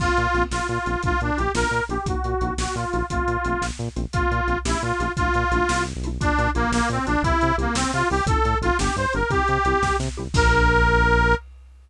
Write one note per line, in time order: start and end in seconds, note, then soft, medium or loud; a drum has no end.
0.00 0.09 A#1 medium
0.00 0.12 A#3 medium
0.00 0.12 C4 medium
0.00 0.43 F4 medium
0.00 0.12 F4 medium
0.00 kick medium
0.00 crash medium
0.17 0.27 A#2 medium
0.17 closed hi-hat medium
0.34 0.44 A#1 medium
0.34 0.46 A#3 medium
0.34 0.46 C4 medium
0.34 0.46 F4 medium
0.34 closed hi-hat medium
0.51 0.61 A#1 medium
0.51 0.67 F4 medium
0.51 snare medium
0.68 0.79 A#2 medium
0.68 1.02 F4 medium
0.68 closed hi-hat medium
0.86 0.96 A#1 medium
0.86 0.92 A#3 medium
0.86 0.92 C4 medium
0.86 0.92 F4 medium
0.86 closed hi-hat medium
1.03 1.13 A#1 medium
1.03 1.15 D4 medium
1.03 1.15 E4 medium
1.03 1.15 F4 medium
1.03 1.21 F4 medium
1.03 kick medium
1.03 closed hi-hat medium
1.07 1.15 A3 medium
1.21 1.31 A#2 medium
1.21 1.38 D4 medium
1.21 closed hi-hat medium
1.38 1.49 A#1 medium
1.38 1.44 A3 medium
1.38 1.44 D4 medium
1.38 1.44 E4 medium
1.38 1.44 F4 medium
1.38 1.52 G4 medium
1.38 closed hi-hat medium
1.55 1.65 A#1 medium
1.55 1.67 A#3 medium
1.55 1.67 D4 medium
1.55 1.67 F4 medium
1.55 1.84 A#4 medium
1.55 snare medium
1.71 1.81 A#2 medium
1.71 closed hi-hat medium
1.89 1.99 A#1 medium
1.89 1.96 A#3 medium
1.89 1.96 D4 medium
1.89 1.96 F4 medium
1.89 2.07 G4 medium
1.89 closed hi-hat medium
2.06 2.15 A#1 medium
2.06 2.19 A#3 medium
2.06 2.19 D#4 medium
2.06 2.19 F#4 loud
2.06 2.54 F#4 medium
2.06 kick medium
2.06 closed hi-hat medium
2.24 2.34 A#2 medium
2.24 closed hi-hat medium
2.41 2.51 A#1 medium
2.41 2.54 A#3 medium
2.41 2.54 D#4 medium
2.41 2.54 F#4 medium
2.41 closed hi-hat medium
2.58 2.67 A#1 medium
2.58 2.75 F#4 medium
2.58 snare medium
2.75 2.85 A#2 medium
2.75 3.06 F4 medium
2.75 closed hi-hat medium
2.93 3.03 A#1 medium
2.93 2.99 A#3 medium
2.93 2.99 D#4 medium
2.93 2.99 F#4 medium
2.93 closed hi-hat medium
3.10 3.20 A#1 medium
3.10 3.23 A3 medium
3.10 3.23 C4 medium
3.10 3.66 F4 medium
3.10 3.23 F4 loud
3.10 kick medium
3.10 closed hi-hat medium
3.28 3.37 A#2 medium
3.28 closed hi-hat medium
3.45 3.55 A#1 medium
3.45 3.57 A3 medium
3.45 3.57 C4 medium
3.45 3.57 F4 medium
3.45 closed hi-hat medium
3.62 3.71 A#1 medium
3.62 snare medium
3.79 3.89 A#2 medium
3.79 closed hi-hat medium
3.96 4.06 A#1 medium
3.96 4.02 A3 medium
3.96 4.02 C4 medium
3.96 4.02 F4 medium
3.96 closed hi-hat medium
4.13 4.23 A#1 medium
4.13 4.26 A#3 medium
4.13 4.26 C4 medium
4.13 4.58 F4 medium
4.13 4.26 F4 medium
4.13 kick medium
4.13 closed hi-hat medium
4.31 4.41 A#2 medium
4.31 closed hi-hat medium
4.48 4.57 A#1 medium
4.48 4.54 A#3 medium
4.48 4.54 C4 medium
4.48 4.54 F4 medium
4.48 closed hi-hat medium
4.65 4.75 A#1 medium
4.65 4.78 A3 medium
4.65 4.78 C#4 medium
4.65 4.82 E4 medium
4.65 4.78 E4 medium
4.65 4.78 G4 loud
4.65 snare medium
4.82 4.92 A#2 medium
4.82 5.12 F4 medium
4.82 closed hi-hat medium
4.99 5.09 A#1 medium
4.99 5.06 A3 medium
4.99 5.06 C#4 medium
4.99 5.06 E4 medium
4.99 5.06 G4 medium
4.99 closed hi-hat medium
5.17 5.28 A#1 medium
5.17 5.29 D4 medium
5.17 5.29 E4 medium
5.17 5.84 F4 medium
5.17 5.29 F4 medium
5.17 kick medium
5.17 closed hi-hat medium
5.21 5.29 A3 medium
5.34 5.44 A#2 medium
5.34 closed hi-hat medium
5.51 5.61 A#1 medium
5.51 5.64 D4 medium
5.51 5.64 E4 medium
5.51 5.64 F4 medium
5.51 closed hi-hat medium
5.55 5.64 A3 medium
5.69 5.93 C2 medium
5.69 snare loud
5.87 closed hi-hat medium
5.95 6.19 B1 medium
6.04 6.10 A3 medium
6.04 6.10 D4 medium
6.04 6.10 E4 medium
6.04 6.10 F4 medium
6.04 closed hi-hat medium
6.21 6.31 A#1 medium
6.21 6.33 A#3 medium
6.21 6.50 D4 medium
6.21 6.33 D4 medium
6.21 6.33 F4 loud
6.21 kick medium
6.21 closed hi-hat medium
6.39 6.48 A#2 medium
6.39 closed hi-hat medium
6.55 6.66 A#1 medium
6.55 6.71 A#3 medium
6.55 6.67 A#3 medium
6.55 6.67 D4 medium
6.55 6.67 F4 medium
6.55 closed hi-hat medium
6.72 6.81 A#1 medium
6.72 6.89 A#3 medium
6.72 snare medium
6.90 6.99 A#2 medium
6.90 7.06 C4 medium
6.90 closed hi-hat medium
7.06 7.17 A#1 medium
7.06 7.13 A#3 medium
7.06 7.22 D4 medium
7.06 7.13 D4 medium
7.06 7.13 F4 medium
7.06 closed hi-hat medium
7.23 7.32 C2 loud
7.23 7.36 C4 loud
7.23 7.56 E4 medium
7.23 7.36 E4 medium
7.23 7.36 G4 medium
7.23 kick medium
7.23 closed hi-hat medium
7.41 7.52 C3 medium
7.41 closed hi-hat medium
7.58 7.67 C2 medium
7.58 7.75 A#3 medium
7.58 7.70 C4 medium
7.58 7.70 E4 medium
7.58 7.70 G4 medium
7.58 closed hi-hat medium
7.75 7.85 C2 medium
7.75 7.91 C4 medium
7.75 snare loud
7.93 8.03 C3 medium
7.93 8.08 F4 medium
7.93 closed hi-hat medium
8.10 8.21 C2 medium
8.10 8.16 C4 medium
8.10 8.16 E4 medium
8.10 8.16 G4 medium
8.10 8.25 G4 medium
8.10 open hi-hat medium
8.26 8.36 A1 medium
8.26 8.39 D#4 loud
8.26 8.39 F4 medium
8.26 8.39 A4 loud
8.26 8.58 A4 medium
8.26 kick loud
8.26 closed hi-hat loud
8.31 8.39 C4 medium
8.45 8.55 A2 medium
8.45 closed hi-hat medium
8.61 8.71 A1 medium
8.61 8.68 D#4 medium
8.61 8.77 F4 medium
8.61 8.68 F4 medium
8.61 8.68 A4 medium
8.61 closed hi-hat medium
8.66 8.69 C4 medium
8.79 8.89 G1 medium
8.79 8.91 B3 loud
8.79 8.91 D4 medium
8.79 8.91 G4 medium
8.79 8.96 G4 medium
8.79 snare loud
8.96 9.06 G2 medium
8.96 9.13 C5 medium
8.96 closed hi-hat medium
9.13 9.24 G1 medium
9.13 9.20 B3 medium
9.13 9.20 D4 medium
9.13 9.20 G4 medium
9.13 9.31 A#4 medium
9.13 closed hi-hat medium
9.30 9.40 C2 medium
9.30 9.43 C4 loud
9.30 9.43 E4 medium
9.30 9.43 G4 medium
9.30 9.96 G4 medium
9.30 kick medium
9.30 closed hi-hat medium
9.48 9.58 C3 medium
9.48 closed hi-hat medium
9.65 9.74 C2 medium
9.65 9.78 C4 medium
9.65 9.78 E4 medium
9.65 9.78 G4 medium
9.65 closed hi-hat medium
9.82 9.92 C2 medium
9.82 kick medium
9.82 snare medium
9.99 10.09 C3 medium
9.99 snare medium
10.17 10.28 C2 medium
10.17 10.23 C4 medium
10.17 10.23 E4 medium
10.17 10.23 G4 medium
10.34 11.35 A#1 loud
10.34 11.33 A#3 loud
10.34 11.33 D4 loud
10.34 11.33 F4 loud
10.34 11.35 A#4 loud
10.34 kick loud
10.34 crash loud